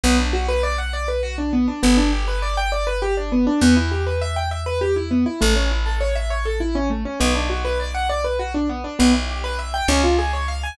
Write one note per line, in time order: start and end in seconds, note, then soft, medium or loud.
0.03 1.68 B1 loud
0.03 0.17 B3 loud
0.18 0.32 D4 medium
0.33 0.47 F#4 medium
0.48 0.62 B4 loud
0.63 0.76 D5 medium
0.78 0.92 F#5 medium
0.93 1.07 D5 medium
1.08 1.22 B4 medium
1.23 1.36 F#4 loud
1.38 1.51 D4 medium
1.53 1.66 B3 medium
1.68 1.81 D4 medium
1.83 3.48 G1 loud
1.83 1.96 B3 loud
1.97 2.11 D4 medium
2.12 2.26 G4 medium
2.28 2.41 B4 medium
2.42 2.56 D5 medium
2.57 2.71 G5 medium
2.72 2.85 D5 medium
2.87 3.00 B4 medium
3.02 3.15 G4 loud
3.17 3.31 D4 medium
3.32 3.45 B3 medium
3.47 3.60 D4 medium
3.61 5.26 E2 loud
3.61 3.75 B3 loud
3.76 3.90 E4 medium
3.91 4.05 G4 medium
4.06 4.20 B4 medium
4.21 4.35 E5 loud
4.36 4.50 G5 medium
4.51 4.65 E5 medium
4.66 4.80 B4 medium
4.81 4.95 G4 medium
4.96 5.09 E4 medium
5.11 5.24 B3 medium
5.26 5.39 E4 medium
5.41 7.06 A1 loud
5.41 5.54 A3 loud
5.56 5.69 C#4 medium
5.71 5.84 E4 medium
5.86 5.99 A4 medium
6.00 6.14 C#5 medium
6.15 6.29 E5 medium
6.30 6.44 C#5 medium
6.45 6.59 A4 medium
6.60 6.74 E4 medium
6.75 6.89 C#4 loud
6.90 7.03 A3 medium
7.05 7.19 C#4 medium
7.20 8.85 B1 loud
7.20 7.33 B3 loud
7.35 7.48 D4 medium
7.50 7.63 F#4 medium
7.65 7.78 B4 medium
7.80 7.93 D5 medium
7.94 8.08 F#5 medium
8.09 8.23 D5 medium
8.24 8.38 B4 medium
8.39 8.53 F#4 medium
8.54 8.68 D4 medium
8.69 8.83 B3 medium
8.84 8.98 D4 medium
8.99 9.82 B1 loud
8.99 9.12 B3 loud
9.14 9.27 E4 medium
9.29 9.42 G4 medium
9.44 9.57 B4 medium
9.59 9.72 E5 medium
9.74 9.87 G5 medium
9.88 10.71 C#2 loud
9.88 10.02 C#4 loud
10.04 10.17 F4 medium
10.18 10.32 G#4 medium
10.33 10.47 C#5 medium
10.48 10.62 F5 medium
10.63 10.77 G#5 medium